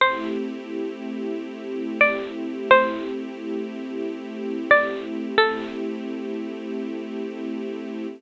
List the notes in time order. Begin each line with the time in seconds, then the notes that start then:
0.00 A3 C4 E4 G4 C5
2.01 D5
2.71 C5
4.71 D5
5.38 A3 C4 E4 G4 A4